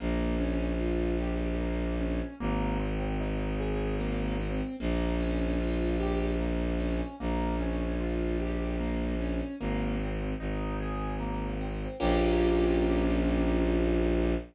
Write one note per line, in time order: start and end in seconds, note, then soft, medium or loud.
0.00 2.21 A#1 loud
0.00 0.36 A#3 medium
0.40 0.76 C#4 medium
0.80 1.16 F4 medium
1.20 1.56 G4 medium
1.60 1.96 A#3 medium
2.00 2.35 C#4 medium
2.40 4.61 G#1 loud
2.40 2.76 A#3 medium
2.80 3.16 C4 medium
3.20 3.56 D#4 medium
3.60 3.96 G#4 medium
4.00 4.36 A#3 medium
4.40 4.76 C4 medium
4.80 7.01 A#1 loud
4.80 5.16 A#3 medium
5.20 5.56 C#4 medium
5.60 5.96 F4 medium
6.00 6.36 G4 medium
6.40 6.76 A#3 medium
6.80 7.16 C#4 medium
7.20 9.41 A#1 loud
7.20 7.56 A#3 medium
7.60 7.96 C#4 medium
8.01 8.37 F4 medium
8.40 8.76 G4 medium
8.80 9.16 A#3 medium
9.20 9.56 C#4 medium
9.60 10.34 G#1 loud
9.60 9.96 A#3 medium
10.00 10.36 C4 medium
10.40 11.87 G#1 medium
10.40 10.76 D#4 medium
10.80 11.16 G#4 medium
11.20 11.56 A#3 medium
11.61 11.97 C4 medium
12.00 14.35 A#1 loud
12.00 14.35 A#3 loud
12.00 14.35 C#4 loud
12.00 14.35 F4 loud
12.00 14.35 G4 loud